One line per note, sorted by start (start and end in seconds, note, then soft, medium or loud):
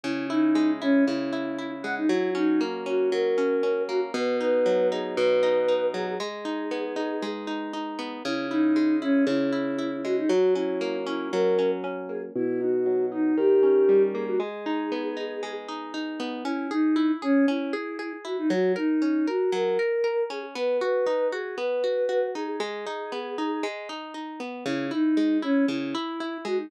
0.04 1.07 C#3 loud
0.04 0.27 E4 loud
0.29 0.71 D#4 loud
0.29 0.81 E4 medium
0.55 1.84 G#3 loud
0.81 1.04 C#4 loud
0.81 1.32 E4 medium
1.06 2.05 C#3 loud
1.06 1.70 E4 loud
1.33 1.58 E4 medium
1.59 2.07 E4 medium
1.83 2.08 G#3 medium
1.83 1.95 F#5 medium
1.97 2.09 D#4 loud
2.09 3.12 F#3 loud
2.09 2.31 E4 loud
2.35 2.86 C#4 medium
2.35 2.61 D#4 loud
2.61 3.88 A#3 medium
2.86 3.37 C#4 medium
2.86 3.10 F#4 loud
3.11 4.10 F#3 loud
3.11 3.82 A#4 loud
3.38 3.63 C#4 medium
3.63 4.12 C#4 medium
3.88 4.13 A#3 medium
3.88 4.00 F#4 loud
4.14 5.17 B2 loud
4.14 4.36 B4 loud
4.40 4.91 D#4 medium
4.40 4.88 B4 loud
4.66 5.93 F#3 medium
4.92 5.42 D#4 medium
4.92 5.15 G#4 loud
5.17 6.15 B2 loud
5.17 5.86 B4 loud
5.43 5.68 D#4 loud
5.68 6.17 D#4 medium
5.94 6.18 F#3 loud
5.94 6.06 G#4 loud
6.07 6.19 G#4 loud
6.20 7.22 G#3 loud
6.20 7.26 G#4 loud
6.45 6.96 D#4 medium
6.71 7.98 B3 medium
6.96 7.47 D#4 medium
7.22 8.20 G#3 loud
7.47 7.73 D#4 medium
7.73 8.22 D#4 medium
7.99 8.23 B3 loud
8.25 9.26 C#3 loud
8.25 8.47 E4 loud
8.50 8.96 D#4 loud
8.50 9.01 E4 medium
8.76 10.04 G#3 medium
9.02 9.24 C#4 loud
9.02 9.52 E4 medium
9.27 10.24 C#3 loud
9.27 9.97 E4 loud
9.52 9.78 E4 medium
9.79 10.27 E4 medium
10.04 10.29 G#3 medium
10.04 10.16 F#4 loud
10.18 10.30 D#4 loud
10.29 11.32 F#3 loud
10.29 10.54 F#4 loud
10.55 11.06 C#4 medium
10.55 10.97 E4 loud
10.81 12.09 A#3 loud
11.07 11.58 C#4 medium
11.07 11.29 E4 loud
11.32 12.30 F#3 loud
11.32 11.71 A#4 loud
11.59 11.83 C#4 medium
11.84 12.33 C#4 medium
12.09 12.34 A#3 medium
12.09 12.22 G#4 loud
12.35 13.33 B2 loud
12.35 12.60 E4 loud
12.61 13.11 D#4 medium
12.61 13.06 F#4 loud
12.86 13.35 F#3 medium
13.12 13.36 D#4 medium
13.12 13.37 D#4 loud
13.37 14.35 D#3 loud
13.37 14.02 G4 loud
13.63 14.36 C#4 medium
13.89 14.38 G3 medium
14.14 14.39 A#3 medium
14.14 14.26 G#4 loud
14.27 14.40 F#4 loud
14.40 15.42 G#3 loud
14.40 15.53 G#4 loud
14.66 15.16 D#4 loud
14.92 16.19 B3 medium
15.17 15.68 D#4 medium
15.43 16.40 G#3 loud
15.68 15.93 D#4 medium
15.94 16.43 D#4 medium
16.20 16.44 B3 loud
16.44 16.71 C#4 loud
16.44 16.68 E4 loud
16.70 17.12 D#4 loud
16.70 16.97 G#4 loud
16.96 17.22 E4 medium
17.22 17.46 C#4 loud
17.22 17.48 G#4 loud
17.48 17.74 C#4 loud
17.48 18.13 E4 loud
17.73 17.99 G#4 medium
17.99 18.25 G#4 medium
18.25 18.49 E4 medium
18.25 18.37 F#4 medium
18.38 18.50 D#4 loud
18.50 18.76 F#3 loud
18.50 18.73 F#4 loud
18.76 19.26 D#4 loud
18.76 19.01 A#4 loud
19.02 19.27 C#4 medium
19.27 19.51 F#4 loud
19.27 19.53 A#4 loud
19.52 19.78 F#3 loud
19.52 20.24 A#4 loud
19.79 20.03 A#4 loud
20.04 20.30 A#4 loud
20.30 20.54 C#4 medium
20.30 20.43 G#4 loud
20.55 20.81 B3 loud
20.55 20.77 B4 loud
20.81 21.07 F#4 loud
20.81 21.28 B4 loud
21.07 21.32 D#4 loud
21.32 21.58 F#4 medium
21.32 21.56 G#4 loud
21.57 21.83 B3 medium
21.57 22.26 B4 loud
21.84 22.08 F#4 medium
22.09 22.35 F#4 medium
22.35 22.60 D#4 medium
22.35 22.47 G#4 loud
22.48 22.60 G#4 loud
22.60 22.86 G#3 loud
22.60 23.68 G#4 loud
22.87 23.12 D#4 loud
23.12 23.38 B3 medium
23.38 23.64 D#4 medium
23.63 23.89 G#3 loud
23.89 24.14 D#4 medium
24.14 24.40 D#4 medium
24.40 24.64 B3 medium
24.66 24.91 C#3 loud
24.66 24.88 E4 loud
24.91 25.38 D#4 loud
24.91 25.17 E4 medium
25.17 25.43 G#3 medium
25.42 25.65 C#4 loud
25.42 25.68 E4 medium
25.68 25.94 C#3 loud
25.68 26.38 E4 loud
25.95 26.20 E4 loud
26.20 26.46 E4 medium
26.45 26.69 G#3 loud
26.45 26.58 F#4 loud
26.57 26.70 D#4 medium